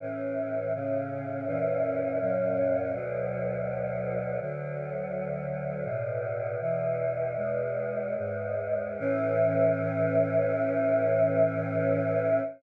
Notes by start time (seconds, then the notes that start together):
0.00 A2 E3 C#4
0.74 A2 C#3 C#4
1.46 F#2 A#2 E3 C#4
2.20 F#2 A#2 F#3 C#4
2.93 D2 B2 F#3
4.40 D2 D3 F#3
5.84 E2 A2 B2
6.60 E2 B2 E3
7.36 E2 B2 G#3
8.17 E2 G#2 G#3
8.99 A2 E3 C#4